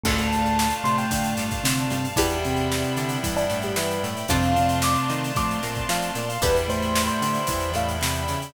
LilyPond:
<<
  \new Staff \with { instrumentName = "Electric Piano 1" } { \time 4/4 \key d \dorian \tempo 4 = 113 a''4. c'''16 g''8. r4 a''8 | g'2 r16 d'8 g'16 b'8 r8 | f''4 d'''8 r8 d'''4 f''8 d''16 f''16 | b'16 r16 c''8. c''4~ c''16 f''8 b''4 | }
  \new Staff \with { instrumentName = "Vibraphone" } { \time 4/4 \key d \dorian <a, a>4. <a, a>4. <c c'>4 | r8 <c c'>4. <g, g>2 | <c c'>8 <c c'>4. <a, a>8 r4. | r8 <a, a>4. <e, e>2 | }
  \new Staff \with { instrumentName = "Pizzicato Strings" } { \time 4/4 \key d \dorian <d' f' a'>8 r4 c'8 d'8 g8 d'8 g8 | <d' e' g' b'>8 r4 d'8 e'8 a8 e'8 a8 | <d' f' a' c''>8 r4 ees'8 f'8 bes8 f'8 bes8 | <d' e' g' b'>8 r4 d'8 e'8 a8 c'8 cis'8 | }
  \new Staff \with { instrumentName = "Electric Piano 2" } { \time 4/4 \key d \dorian <a d' f'>1 | <g b d' e'>1 | <a c' d' f'>1 | <g b d' e'>1 | }
  \new Staff \with { instrumentName = "Synth Bass 1" } { \clef bass \time 4/4 \key d \dorian d,4. c8 d8 g,8 d8 g,8 | e,4. d8 e8 a,8 e8 a,8 | f,4. ees8 f8 bes,8 f8 bes,8 | e,4. d8 e8 a,8 c8 cis8 | }
  \new Staff \with { instrumentName = "String Ensemble 1" } { \time 4/4 \key d \dorian <d'' f'' a''>1 | <d'' e'' g'' b''>1 | <d'' f'' a'' c'''>1 | <d'' e'' g'' b''>1 | }
  \new DrumStaff \with { instrumentName = "Drums" } \drummode { \time 4/4 <cymc bd>16 hh16 hh16 hh16 sn16 hh16 hh16 hh16 <hh bd>16 hh16 <hh sn>16 <hh bd>16 sn16 hh16 hh16 hh16 | <hh bd>16 hh16 hh16 <hh sn>16 sn16 hh16 hh16 hh16 <hh bd>16 hh16 <hh sn>16 <hh sn>16 sn16 hh16 hh16 hh16 | <hh bd>16 hh16 hh16 hh16 sn16 hh16 hh16 hh16 <hh bd>16 <hh sn>16 <hh sn>16 <hh bd>16 sn16 <hh sn>16 hh16 hh16 | <hh bd>16 hh16 hh16 hh16 sn16 hh16 hh16 hh16 <hh bd>16 hh16 <hh sn>16 hh16 sn16 hh16 <hh sn>16 hh16 | }
>>